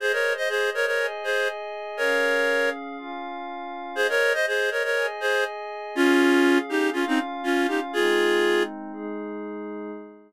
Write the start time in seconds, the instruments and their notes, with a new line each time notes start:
0.00 pad 5 (bowed) G#4 C5 D#5, clarinet G#4 C5
0.13 clarinet A#4 C#5
0.37 clarinet C5 D#5
0.49 clarinet G#4 C5
0.74 clarinet A#4 C#5
0.86 clarinet A#4 C#5
0.99 pad 5 (bowed) G#4 D#5 G#5
1.24 clarinet G#4 C5
1.97 pad 5 (bowed) C#4 G#4 F5, clarinet A#4 C#5
2.98 pad 5 (bowed) C#4 F4 F5
3.95 clarinet G#4 C5, pad 5 (bowed) G#4 C5 D#5
4.09 clarinet A#4 C#5
4.34 clarinet C5 D#5
4.47 clarinet G#4 C5
4.71 clarinet A#4 C#5
4.84 clarinet A#4 C#5
4.96 pad 5 (bowed) G#4 D#5 G#5
5.20 clarinet G#4 C5
5.95 pad 5 (bowed) C#4 G#4 F5, clarinet C#4 F4
6.69 clarinet D#4 G4
6.93 clarinet C#4 F4, pad 5 (bowed) C#4 F4 F5
7.07 clarinet C4 D#4
7.44 clarinet C#4 F4
7.68 clarinet D#4 G4
7.93 pad 5 (bowed) G#3 C4 D#4, clarinet F4 G#4
8.93 pad 5 (bowed) G#3 D#4 G#4